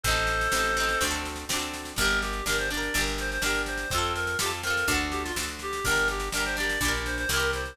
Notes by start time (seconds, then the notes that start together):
0.03 A1 C4 A4 C5, kick, snare
0.08 D#4 A4
0.16 snare
0.27 snare
0.41 snare
0.52 A1 C4 D#4, snare
0.59 A4
0.63 snare
0.77 C4 D#4, snare
0.83 A4
0.89 snare
1.01 D2 C4 D4, kick, snare
1.07 F#4 A4
1.13 snare
1.26 snare
1.36 snare
1.49 D2 C4 D4, snare
1.56 F#4 A4
1.62 snare
1.73 snare
1.85 snare
1.96 G1 D4 A#4, kick, snare
2.01 G4 A#4
2.08 snare
2.21 G4, snare
2.33 snare
2.46 G1 D4 G4 A#4, snare
2.53 A#4
2.58 C5, snare
2.70 D4 D5, snare
2.74 G4 A#4
2.82 snare
2.94 G1 D4 G4, kick, snare
3.01 A#4
3.07 snare
3.18 C5, snare
3.31 C5, snare
3.42 G1 D4 A#4, snare
3.46 G4 A#4
3.55 snare
3.66 C5, snare
3.78 snare
3.90 F2 C4 A4, kick, snare
3.95 F4 A4
4.02 snare
4.15 A#4, snare
4.27 snare
4.39 F2 C4 F4 G4, snare
4.46 A4
4.51 snare
4.63 C4 F4 A#4, snare
4.70 A4
4.77 snare
4.87 D2 D4 F#4, kick, snare
4.94 A4, snare
5.11 G4, snare
5.24 F4, snare
5.36 D2 D4 F#4, snare
5.43 A4
5.48 snare
5.59 G4, snare
5.73 snare
5.84 G1 D4 G4 A#4, kick, snare
5.91 A#4
5.96 snare
6.08 G4, snare
6.20 snare
6.32 G1 D4 A#4, snare
6.37 G4 A#4
6.45 C5, snare
6.57 D4 G4 D5, snare
6.63 A#4
6.69 snare
6.81 A#1 D4, kick, snare
6.85 G4 A#4
6.94 snare
7.06 C5, snare
7.18 C5, snare
7.29 C2 C4 E4 A#4, snare
7.36 G4 A#4
7.41 snare
7.53 C5, snare
7.65 snare